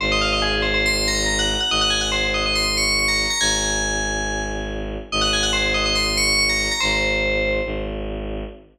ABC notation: X:1
M:4/4
L:1/16
Q:1/4=141
K:Abmix
V:1 name="Tubular Bells"
c e f e A2 c c c'2 b2 b g2 g | e g a g c2 e e c'2 d'2 d' b2 b | a10 z6 | e g a g c2 e e c'2 d'2 d' b2 b |
c8 z8 |]
V:2 name="Violin" clef=bass
A,,,16 | A,,,16 | A,,,16 | A,,,16 |
A,,,8 A,,,8 |]